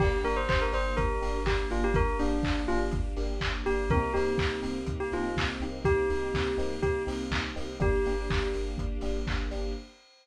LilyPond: <<
  \new Staff \with { instrumentName = "Tubular Bells" } { \time 4/4 \key g \minor \tempo 4 = 123 g'8 bes'16 c''16 c''16 bes'16 c''8 bes'4 g'8 f'16 g'16 | bes'8 d'4 f'16 r4. r16 g'8 | bes'8 g'4 r8. g'16 f'8 r4 | g'2 g'8 r4. |
g'4. r2 r8 | }
  \new Staff \with { instrumentName = "Electric Piano 1" } { \time 4/4 \key g \minor <bes d' g'>8 <bes d' g'>4 <bes d' g'>4 <bes d' g'>4 <bes d' g'>8~ | <bes d' g'>8 <bes d' g'>4 <bes d' g'>4 <bes d' g'>4 <bes d' g'>8 | <bes c' ees' g'>8 <bes c' ees' g'>4 <bes c' ees' g'>4 <bes c' ees' g'>4 <bes c' ees' g'>8~ | <bes c' ees' g'>8 <bes c' ees' g'>4 <bes c' ees' g'>4 <bes c' ees' g'>4 <bes c' ees' g'>8 |
<bes d' g'>8 <bes d' g'>4 <bes d' g'>4 <bes d' g'>4 <bes d' g'>8 | }
  \new Staff \with { instrumentName = "Synth Bass 2" } { \clef bass \time 4/4 \key g \minor g,,8 g,,8 g,,8 g,,8 g,,8 g,,8 g,,8 g,,8 | g,,8 g,,8 g,,8 g,,8 g,,8 g,,8 g,,8 g,,8 | c,8 c,8 c,8 c,8 c,8 c,8 c,8 c,8 | c,8 c,8 c,8 c,8 c,8 c,8 c,8 c,8 |
g,,8 g,,8 g,,8 g,,8 g,,8 g,,8 g,,8 g,,8 | }
  \new Staff \with { instrumentName = "String Ensemble 1" } { \time 4/4 \key g \minor <bes d' g'>1~ | <bes d' g'>1 | <bes c' ees' g'>1~ | <bes c' ees' g'>1 |
<bes d' g'>1 | }
  \new DrumStaff \with { instrumentName = "Drums" } \drummode { \time 4/4 <cymc bd>8 hho8 <hc bd>8 hho8 <hh bd>8 hho8 <hc bd>8 hho8 | <hh bd>8 hho8 <hc bd>8 hho8 <hh bd>8 hho8 <hc bd>8 hho8 | <hh bd>8 hho8 <hc bd>8 hho8 <hh bd>8 hho8 <hc bd>8 hho8 | <hh bd>8 hho8 <hc bd>8 hho8 <hh bd>8 hho8 <hc bd>8 hho8 |
<hh bd>8 hho8 <hc bd>8 hho8 <hh bd>8 hho8 <hc bd>8 hho8 | }
>>